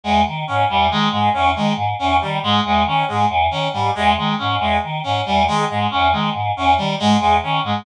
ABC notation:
X:1
M:3/4
L:1/8
Q:1/4=138
K:none
V:1 name="Choir Aahs" clef=bass
E,, _E, _A,, =E,, _E, A,, | E,, _E, _A,, =E,, _E, A,, | E,, _E, _A,, =E,, _E, A,, | E,, _E, _A,, =E,, _E, A,, |
E,, _E, _A,, =E,, _E, A,, | E,, _E, _A,, =E,, _E, A,, |]
V:2 name="Clarinet"
_A, z _D G, A, A, | _D _A, z D G, A, | _A, _D A, z D G, | _A, A, _D A, z D |
G, _A, A, _D A, z | _D G, _A, A, D A, |]